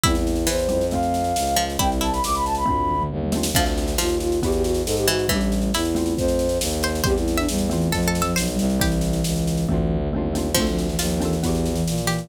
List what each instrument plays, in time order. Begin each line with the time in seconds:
0.03 violin E2, xylophone G3 C4, pizzicato strings E4, flute E4, kick, snare
0.08 xylophone E4
0.15 flute E4, snare
0.27 snare
0.35 snare
0.47 violin E2, pizzicato strings E3, flute C5, snare
0.59 snare
0.69 violin F2, xylophone G3 C4 E4, snare
0.81 snare
0.91 xylophone A3 C4, flute F5, kick, snare
0.95 xylophone F4
1.03 snare
1.14 snare
1.24 snare
1.36 violin C#2, snare
1.47 snare
1.56 pizzicato strings F3, snare
1.70 snare
1.79 violin C2, xylophone G3 C4 E4, pizzicato strings E4, flute G5, kick, snare
1.92 snare
2.01 pizzicato strings E4, flute A5, snare
2.12 flute B5, snare
2.24 violin C#2, flute D6, snare
2.35 flute B5, snare
2.45 flute A5, snare
2.55 flute B5, snare
2.66 violin D2, xylophone A3 C4 D4, kick, floor tom
2.70 xylophone F4
2.78 floor tom
2.89 mid tom
3.01 mid tom
3.10 violin D#2, high tom
3.23 high tom
3.32 xylophone A3 C4 D4, snare
3.37 xylophone F4
3.43 snare
3.54 violin D2, pizzicato strings F3, xylophone C4 D4, flute F5, kick, snare, crash
3.58 xylophone F4 A4
3.66 snare
3.78 snare
3.88 snare
3.98 violin D#2, pizzicato strings F3, flute F4, snare
4.08 snare
4.20 flute F4, snare
4.32 snare
4.42 violin E2, xylophone B3 E4 F#4, flute G4, kick, snare
4.48 xylophone G4
4.52 flute G4, snare
4.63 flute F#4, snare
4.74 snare
4.85 violin G#2, flute A4, snare
4.97 flute G4, snare
5.08 pizzicato strings E3, flute F#4, snare
5.19 snare
5.28 violin A1, pizzicato strings E3, flute G3, xylophone A3, kick, snare
5.33 xylophone D4 E4 G4
5.41 snare
5.52 snare
5.62 snare
5.73 violin E2, flute E4, pizzicato strings E4, snare
5.85 snare
5.95 xylophone A3 C4 F4, snare
6.06 snare
6.17 violin F2, flute C5, kick, snare
6.28 snare
6.39 snare
6.49 snare
6.61 violin D#2, snare
6.71 snare
6.83 pizzicato strings C5, snare
6.95 snare
7.04 violin E2, xylophone G3 C4, flute G4, pizzicato strings C5, kick, snare
7.08 xylophone E4
7.16 flute E4, snare
7.28 snare
7.37 flute D4, pizzicato strings E5, snare
7.48 violin E2, flute G3, snare
7.58 snare
7.70 flute E3, xylophone A3 C4 F4, snare
7.81 snare
7.92 violin F2, flute F3, pizzicato strings A4, kick, snare
8.03 snare
8.08 pizzicato strings A4
8.15 snare
8.22 flute F3, pizzicato strings A4, snare
8.36 violin B1, pizzicato strings C5, snare
8.48 flute G3, snare
8.59 violin C2, snare
8.70 snare
8.80 flute E3, xylophone G3 C4 E4, pizzicato strings G4, kick, snare
8.92 snare
9.01 snare
9.13 snare
9.24 violin C#2, snare
9.36 snare
9.47 snare
9.57 snare
9.67 violin D2, xylophone A3 C4, kick, floor tom
9.72 xylophone D4 F4
9.77 floor tom
9.89 mid tom
10.00 mid tom
10.11 violin D#2, xylophone A3 C4, high tom
10.16 xylophone D4 F4
10.33 xylophone A3 C4 D4, snare
10.38 xylophone F4
10.54 violin D2, pizzicato strings F3, flute A3, xylophone C4, kick, snare, crash
10.58 xylophone D4 F4 A4
10.67 flute F3, snare
10.78 snare
10.87 flute E3, snare
10.99 violin D#2, flute F3, pizzicato strings F4, snare
11.10 snare
11.20 flute E3, xylophone C4 D4 F4, snare
11.25 xylophone A4
11.33 snare
11.43 violin E2, flute E3, xylophone B3 E4 F#4, kick, snare
11.48 xylophone G4
11.55 snare
11.66 snare
11.73 flute E3, snare
11.87 violin A#2, snare
11.98 snare
12.02 flute E3
12.07 pizzicato strings G4, snare
12.18 snare